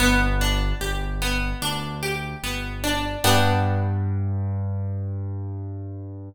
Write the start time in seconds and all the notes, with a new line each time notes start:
0.00 G1 B3
0.41 D4
0.81 G1 G4
1.22 B3
1.62 D2 D4
2.03 G4
2.43 G1 B3
2.84 D4
3.24 G2 B3 D4 G4